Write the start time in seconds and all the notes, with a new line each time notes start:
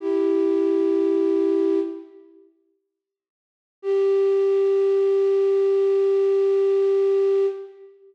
0.00 E4 G4
3.82 G4